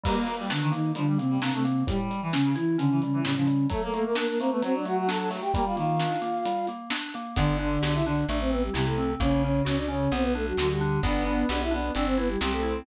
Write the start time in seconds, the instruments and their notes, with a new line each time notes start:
0.03 electric piano 2 G3, flute G3 G4, clarinet A#3, kick, crash
0.27 electric piano 2 A#3, closed hi-hat
0.39 clarinet G3
0.50 flute D3 D4, electric piano 2 D4, snare
0.62 clarinet D#3
0.72 flute D#3 D#4, electric piano 2 A#3, closed hi-hat
0.95 flute D3 D4, clarinet F3, electric piano 2 G3, closed hi-hat
1.07 clarinet G3
1.18 flute C3 C4, electric piano 2 A#3, closed hi-hat
1.30 clarinet G3
1.40 flute C3 C4, clarinet A#3, electric piano 2 D4, snare
1.53 flute C3 C4, clarinet A3
1.64 electric piano 2 A#3, closed hi-hat
1.87 electric piano 2 A2, flute G3 G4, clarinet G3, kick, closed hi-hat
2.10 electric piano 2 G3, closed hi-hat
2.22 clarinet E3
2.33 flute C#3 C#4, electric piano 2 C#4, snare
2.44 clarinet C#3
2.55 flute E3 E4, electric piano 2 E4, closed hi-hat
2.78 flute C#3 C#4, clarinet D3, electric piano 2 C#4, closed hi-hat
2.91 clarinet E3
3.02 flute C#3 C#4, electric piano 2 G3, closed hi-hat
3.13 clarinet E3
3.24 electric piano 2 A2, flute C#3 C#4, clarinet G3, snare
3.35 flute C#3 C#4, clarinet F3
3.47 electric piano 2 G3, closed hi-hat
3.70 electric piano 2 F#3, clarinet A3, flute A3 A4, kick, closed hi-hat
3.82 flute A3 A4, clarinet A#3
3.93 electric piano 2 A3, flute A3 A4, clarinet A#3, closed hi-hat
4.04 flute A#3 A#4, clarinet A#3
4.15 flute A#3 A#4, electric piano 2 D4, snare
4.28 flute A#3 A#4
4.39 electric piano 2 A3, clarinet A#3, flute C4 C5, closed hi-hat
4.51 clarinet A3, flute B3 B4
4.62 electric piano 2 F#3, clarinet F#3, flute C4 C5, closed hi-hat
4.74 flute D4 D5
4.85 electric piano 2 A3, flute F#4 F#5, closed hi-hat
4.97 flute F#4 F#5
5.08 electric piano 2 D4, flute A4 A5, snare
5.19 flute A4 A5
5.30 electric piano 2 A3, open hi-hat
5.41 flute G4 G5
5.53 electric piano 2 G3, clarinet A#3, flute G4 G5, kick, closed hi-hat
5.65 clarinet G3, flute F4 F5
5.76 clarinet D#3, electric piano 2 A#3, flute F4 F5, closed hi-hat
6.00 electric piano 2 D4, snare
6.22 electric piano 2 A#3, closed hi-hat
6.45 electric piano 2 G3, closed hi-hat
6.67 electric piano 2 A#3, closed hi-hat
6.90 electric piano 2 D4, snare
7.14 electric piano 2 A#3, closed hi-hat
7.36 electric bass (finger) G1, clarinet D3, electric piano 2 B3, flute D4 D5, kick, closed hi-hat
7.59 electric piano 2 D4, flute D4 D5
7.82 electric bass (finger) B1, flute D4 D5, electric piano 2 G4, snare
7.94 flute E4 E5
8.06 clarinet D3, electric piano 2 D4, flute D4 D5
8.28 electric bass (finger) A1, electric piano 2 A3, flute D4 D5, closed hi-hat
8.40 flute C4 C5
8.50 flute B3 B4, electric piano 2 C4
8.63 flute G3 G4
8.74 electric bass (finger) C2, clarinet C3, flute G3 G4, electric piano 2 E4, snare
8.86 flute A3 A4
8.98 electric piano 2 C4
9.20 electric bass (finger) A#1, clarinet C#3, electric piano 2 A#3, flute C#4 C#5, kick, closed hi-hat
9.43 flute C#4 C#5, electric piano 2 C#4
9.65 electric bass (finger) C#2, flute C#4 C#5, electric piano 2 F#4, snare
9.77 flute D4 D5
9.88 clarinet C#3, electric piano 2 C#4, flute C#4 C#5
10.12 electric bass (finger) B1, electric piano 2 B3, flute C4 C5, closed hi-hat
10.22 flute B3 B4
10.35 flute A3 A4, electric piano 2 D4
10.47 flute F#3 F#4
10.57 electric bass (finger) D2, clarinet D3, flute F#3 F#4, electric piano 2 F#4, snare
10.69 flute G3 G4
10.81 electric piano 2 D4
11.03 electric bass (finger) G1, electric piano 2 B3, clarinet B3, flute D4 D5, kick, closed hi-hat
11.25 flute D4 D5, electric piano 2 D4
11.49 electric bass (finger) B1, flute D4 D5, electric piano 2 G4, snare
11.62 flute E4 E5
11.71 clarinet B3, electric piano 2 D4, flute D4 D5
11.95 electric bass (finger) G1, electric piano 2 C4, flute D4 D5, closed hi-hat
12.06 flute C4 C5
12.17 flute B3 B4, electric piano 2 E4
12.28 flute G3 G4
12.41 electric bass (finger) C2, flute G3 G4, clarinet C4, electric piano 2 G4, snare
12.52 flute A3 A4
12.63 electric piano 2 E4